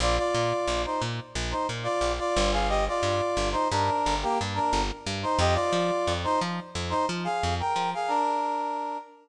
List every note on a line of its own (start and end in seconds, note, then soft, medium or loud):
0.00 0.19 A#1 loud
0.00 0.17 F4 loud
0.00 0.17 D5 loud
0.18 0.82 F4 medium
0.18 0.82 D5 loud
0.35 0.53 A#2 medium
0.67 0.86 A#1 medium
0.85 1.01 D#4 medium
0.85 1.01 C5 medium
1.02 1.20 A#2 medium
1.35 1.54 A#1 medium
1.51 1.67 D#4 medium
1.51 1.67 C5 medium
1.69 1.88 A#2 medium
1.83 2.12 F4 medium
1.83 2.12 D5 loud
2.01 2.20 A#1 medium
2.19 2.51 F4 medium
2.19 2.51 D5 loud
2.37 2.89 G1 loud
2.52 2.68 G#4 medium
2.52 2.68 F5 loud
2.69 2.85 G4 loud
2.69 2.85 D#5 loud
2.88 3.49 F4 medium
2.88 3.49 D5 loud
3.03 3.21 G2 medium
3.37 3.55 G1 medium
3.52 3.68 D#4 medium
3.52 3.68 C5 loud
3.70 3.90 G2 medium
3.70 4.15 D4 medium
3.70 4.15 A#4 loud
4.06 4.25 G1 medium
4.23 4.39 A#3 loud
4.23 4.39 G4 loud
4.41 4.59 G2 medium
4.54 4.82 D4 medium
4.54 4.82 A#4 loud
4.73 4.91 G1 medium
5.06 5.25 G2 medium
5.23 5.39 D#4 medium
5.23 5.39 C5 loud
5.39 5.57 F2 loud
5.39 5.55 G4 loud
5.39 5.55 D#5 loud
5.54 6.13 F4 medium
5.54 6.13 D5 loud
5.72 5.91 F3 medium
6.07 6.26 F2 medium
6.24 6.40 D#4 loud
6.24 6.40 C5 loud
6.41 6.60 F3 medium
6.75 6.94 F2 medium
6.90 7.06 D#4 loud
6.90 7.06 C5 loud
7.09 7.28 F3 medium
7.24 7.55 G#4 medium
7.24 7.55 F5 loud
7.43 7.62 F2 medium
7.60 7.90 A#4 medium
7.60 7.90 G5 loud
7.76 7.94 F3 medium
7.94 8.10 G#4 medium
7.94 8.10 F5 loud
8.08 8.97 D4 loud
8.08 8.97 A#4 loud